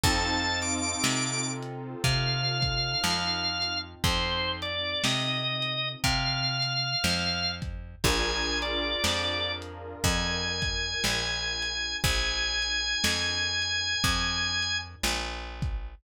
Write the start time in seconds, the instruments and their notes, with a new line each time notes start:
0.04 electric bass (finger) F2, acoustic grand piano C4 D#4 F4 A4, drawbar organ A5, kick, closed hi-hat
0.62 drawbar organ D6, closed hi-hat
1.04 electric bass (finger) C3, snare
1.63 closed hi-hat
2.04 electric bass (finger) C3, drawbar organ F5, kick, closed hi-hat
2.62 kick, closed hi-hat
3.04 electric bass (finger) F2, snare
3.62 closed hi-hat
4.04 electric bass (finger) F2, drawbar organ C5, kick, closed hi-hat
4.62 drawbar organ D5, closed hi-hat
5.04 electric bass (finger) C3, drawbar organ D#5, snare
5.62 closed hi-hat
6.04 electric bass (finger) C3, drawbar organ F5, kick, closed hi-hat
6.62 closed hi-hat
7.04 electric bass (finger) F2, snare
7.62 kick, closed hi-hat
8.04 electric bass (finger) A#1, acoustic grand piano D4 F4 G#4 A#4, drawbar organ G#5, kick, closed hi-hat
8.62 drawbar organ D5, closed hi-hat
9.04 electric bass (finger) F2, snare
9.62 closed hi-hat
10.04 electric bass (finger) F2, drawbar organ G#5, kick, closed hi-hat
10.62 kick, closed hi-hat
11.04 electric bass (finger) A#1, snare
11.62 closed hi-hat
12.04 electric bass (finger) A#1, drawbar organ G#5, kick, closed hi-hat
12.62 closed hi-hat
13.04 electric bass (finger) F2, snare
13.62 closed hi-hat
14.04 electric bass (finger) F2, kick, closed hi-hat
14.62 closed hi-hat
15.04 electric bass (finger) A#1, snare
15.62 kick, closed hi-hat